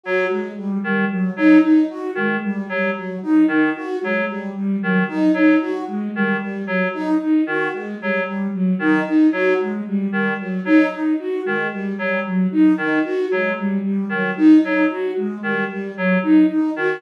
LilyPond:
<<
  \new Staff \with { instrumentName = "Clarinet" } { \clef bass \time 2/4 \tempo 4 = 113 fis8 r4 dis8 | r8 fis8 r4 | dis8 r8 fis8 r8 | r8 dis8 r8 fis8 |
r4 dis8 r8 | fis8 r4 dis8 | r8 fis8 r4 | dis8 r8 fis8 r8 |
r8 dis8 r8 fis8 | r4 dis8 r8 | fis8 r4 dis8 | r8 fis8 r4 |
dis8 r8 fis8 r8 | r8 dis8 r8 fis8 | r4 dis8 r8 | fis8 r4 dis8 | }
  \new Staff \with { instrumentName = "Flute" } { \time 2/4 fis'8 gis8 g8 g8 | fis8 dis'8 dis'8 fis'8 | gis8 g8 g8 fis8 | dis'8 dis'8 fis'8 gis8 |
g8 g8 fis8 dis'8 | dis'8 fis'8 gis8 g8 | g8 fis8 dis'8 dis'8 | fis'8 gis8 g8 g8 |
fis8 dis'8 dis'8 fis'8 | gis8 g8 g8 fis8 | dis'8 dis'8 fis'8 gis8 | g8 g8 fis8 dis'8 |
dis'8 fis'8 gis8 g8 | g8 fis8 dis'8 dis'8 | fis'8 gis8 g8 g8 | fis8 dis'8 dis'8 fis'8 | }
>>